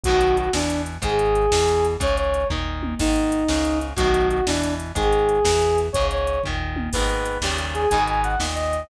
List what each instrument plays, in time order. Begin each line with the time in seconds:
0.03 synth bass 1 B1, overdriven guitar F#2 A2, lead 2 (sawtooth) F#4, kick, closed hi-hat
0.08 overdriven guitar B2 D#3
0.21 closed hi-hat
0.37 lead 2 (sawtooth) F#4, closed hi-hat
0.53 synth bass 1 E2, overdriven guitar B2 E3, lead 2 (sawtooth) D4, snare
0.70 closed hi-hat
0.86 closed hi-hat
1.02 synth bass 1 G#1, overdriven guitar G#2 D#3, lead 2 (sawtooth) G#4, kick, closed hi-hat
1.19 closed hi-hat
1.35 closed hi-hat
1.52 synth bass 1 E2, overdriven guitar B2 E3, snare
1.68 closed hi-hat
1.85 closed hi-hat
2.00 synth bass 1 C#2, overdriven guitar G#2 C#3, lead 2 (sawtooth) C#5, kick, closed hi-hat
2.17 lead 2 (sawtooth) C#5, closed hi-hat
2.34 closed hi-hat
2.50 synth bass 1 D#2, overdriven guitar A#2 D#3, kick, floor tom
2.83 high tom
2.99 synth bass 1 G#1, overdriven guitar G#2 D#3, lead 2 (sawtooth) D#4, kick, crash
3.16 closed hi-hat
3.32 closed hi-hat
3.48 synth bass 1 C#2, overdriven guitar G#2 C#3, snare
3.65 closed hi-hat
3.81 closed hi-hat
3.96 synth bass 1 B1, overdriven guitar F#2 A2 B2 D#3, lead 2 (sawtooth) F#4, kick, closed hi-hat
4.14 closed hi-hat
4.30 lead 2 (sawtooth) F#4, closed hi-hat
4.46 synth bass 1 E2, overdriven guitar B2 E3, lead 2 (sawtooth) D4, snare
4.63 closed hi-hat
4.80 closed hi-hat
4.95 synth bass 1 G#1, overdriven guitar G#2 D#3, lead 2 (sawtooth) G#4, kick, closed hi-hat
5.13 closed hi-hat
5.29 closed hi-hat
5.45 synth bass 1 E2, overdriven guitar B2 E3, snare
5.62 closed hi-hat
5.78 closed hi-hat
5.93 synth bass 1 C#2, overdriven guitar G#2 C#3, lead 2 (sawtooth) C#5, kick, closed hi-hat
6.11 lead 2 (sawtooth) C#5, closed hi-hat
6.27 closed hi-hat
6.44 synth bass 1 D#2, overdriven guitar A#2 D#3, kick, floor tom
6.76 high tom
6.93 synth bass 1 G#1, overdriven guitar G#2 B2 D#3, lead 2 (sawtooth) B4, kick, crash
7.09 closed hi-hat
7.25 closed hi-hat
7.41 synth bass 1 D#2, overdriven guitar G2 A#2 C#3, lead 2 (sawtooth) G4, snare
7.46 overdriven guitar D#3
7.58 closed hi-hat
7.74 lead 2 (sawtooth) G#4, closed hi-hat
7.89 synth bass 1 G#1, overdriven guitar G#2 B2, lead 2 (sawtooth) G#5, kick, closed hi-hat
7.94 overdriven guitar D#3
8.08 lead 2 (sawtooth) G#5, closed hi-hat
8.23 lead 2 (sawtooth) F#5, closed hi-hat
8.39 synth bass 1 D#2, overdriven guitar A#2 D#3, snare
8.55 lead 2 (sawtooth) D#5, closed hi-hat
8.73 closed hi-hat